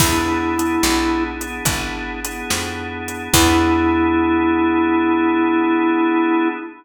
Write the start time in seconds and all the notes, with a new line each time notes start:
0.00 E2 B3 D4 E4 G#4, kick, crash
0.58 B3 D4 E4 G#4, closed hi-hat
0.83 B1, snare
1.41 B3 D4 E4 G#4, closed hi-hat
1.65 G#1 B3 D4 E4 G#4, kick, closed hi-hat
2.25 B3 D4 E4 G#4, closed hi-hat
2.50 F2, snare
3.08 closed hi-hat
3.33 E2 B3 D4 E4 G#4, kick, crash